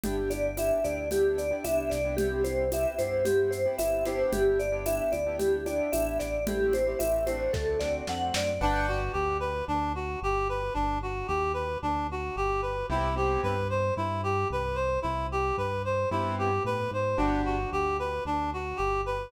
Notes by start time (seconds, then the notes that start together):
0.04 G1 B3 D4 E4 G4, low conga, shaker
0.17 B3 D4 E4 G4
0.30 D5, high conga, shaker
0.57 B3 D4 E4 G4 E5, tambourine, high conga, shaker
0.84 D2 B3 D4 E4 G4 D5, shaker
1.11 B3 D4 E4 G4, low conga, shaker
1.38 D5, shaker
1.51 B3 D4 E4 G4
1.64 C2 B3 D4 E4 G4 E5, tambourine, high conga, shaker
1.90 C2 D5, snare, shaker
2.05 B3 D4 E4 G4
2.17 B3 C4 E4 G4, low conga, shaker
2.32 B3 C4 E4 G4
2.44 C5, high conga, shaker
2.72 B3 C4 E4 G4 E5, tambourine, high conga, shaker
2.98 G2 B3 C4 E4 G4 C5, high conga, shaker
3.25 B3 C4 E4 G4, low conga, shaker
3.51 C5, shaker
3.66 B3 C4 E4 G4
3.78 G1 B3 C4 E4 G4 E5, tambourine, high conga, shaker
4.05 B3 D4 E4 G4 C5, snare, high conga, shaker
4.32 G1 G4, low conga, shaker
4.59 D5, shaker
4.72 B3 D4 E4 G4
4.86 B3 D4 E4 G4 E5, tambourine, high conga, shaker
5.12 D2 D5, high conga, shaker
5.26 B3 D4 E4 G4
5.39 G4, low conga, shaker
5.66 B3 D4 E4 G4 D5, high conga, shaker
5.92 A1 B3 D4 E4 G4 E5, tambourine, high conga, shaker
6.20 A1 D5, snare, shaker
6.47 A3 C4 E4 G4, low conga, shaker
6.73 C5, high conga, shaker
6.87 A3 C4 E4 G4
6.99 A1 A3 C4 E4 G4 E5, tambourine, high conga, shaker
7.27 A3 C4 D4 F#4 C5, high conga, shaker
7.53 D2 A4, kick, snare
7.80 A3 C4 D4 F#4 D5, snare
8.07 F2 A3 C4 D4 F#4 F#5, snare
8.34 F#2 D5, snare
8.61 G1 D4 B4 D5 F#5 G5
8.88 F#4
9.13 D2 G4
9.40 B4
9.68 D2 D4
9.95 F#4
10.22 G1 G4
10.49 B4
10.74 G1 D4
11.02 F#4
11.28 D#2 G4
11.54 B4
11.82 D2 D4
12.11 F#4
12.36 G1 G4
12.62 B4
12.90 C2 B3 C4 E4 G4
13.16 B3 C4 E4 G4
13.43 G2 B4
13.70 C5
13.97 G2 E4
14.23 G4
14.50 C2 B4
14.75 C5
15.02 C2 E4
15.32 G4
15.57 G2 B4
15.85 C5
16.11 G2 B3 C4 E4 G4
16.39 G4
16.65 A2 B4
16.91 G#2 C5
17.17 G1 B3 D4 F#4 G4
17.46 F#4
17.72 D2 G4
17.99 B4
18.25 D2 D4
18.53 F#4
18.77 G1 G4
19.06 B4